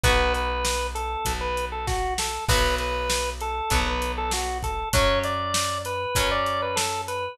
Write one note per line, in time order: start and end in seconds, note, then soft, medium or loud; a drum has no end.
0.03 1.16 B1 loud
0.03 2.24 B3 medium
0.03 2.24 F#4 medium
0.03 0.33 B4 loud
0.03 kick medium
0.03 closed hi-hat medium
0.34 0.87 B4 loud
0.34 closed hi-hat medium
0.65 snare loud
0.95 1.33 A4 loud
0.95 closed hi-hat medium
1.25 2.39 B1 medium
1.25 kick medium
1.25 closed hi-hat medium
1.41 1.65 B4 loud
1.57 closed hi-hat medium
1.72 1.86 A4 medium
1.87 2.14 F#4 loud
1.87 kick medium
1.87 snare medium
2.18 2.45 A4 medium
2.18 snare loud
2.48 3.61 B1 loud
2.48 3.60 F#3 medium
2.48 3.60 B3 medium
2.48 2.75 B4 loud
2.48 kick loud
2.48 crash medium
2.78 3.30 B4 loud
2.78 closed hi-hat medium
3.10 snare loud
3.41 3.80 A4 loud
3.41 closed hi-hat medium
3.70 4.84 B1 medium
3.70 4.81 F#3 medium
3.70 4.81 B3 medium
3.70 kick medium
3.70 closed hi-hat medium
3.87 4.12 B4 loud
4.02 closed hi-hat medium
4.18 4.32 A4 loud
4.31 4.58 F#4 medium
4.31 snare medium
4.63 4.89 A4 loud
4.63 kick medium
4.63 closed hi-hat medium
4.93 6.06 F#2 loud
4.93 6.04 F#3 medium
4.93 6.04 C#4 medium
4.93 5.19 C#5 loud
4.93 kick medium
4.93 closed hi-hat loud
5.23 5.78 D5 loud
5.23 closed hi-hat medium
5.54 snare loud
5.85 6.30 B4 loud
5.85 closed hi-hat medium
6.15 7.29 F#2 medium
6.15 7.26 F#3 medium
6.15 7.26 C#4 medium
6.15 kick medium
6.15 closed hi-hat loud
6.31 6.61 D5 loud
6.46 closed hi-hat medium
6.62 6.77 B4 medium
6.76 7.02 A4 loud
6.76 snare loud
7.08 7.38 B4 medium
7.08 closed hi-hat medium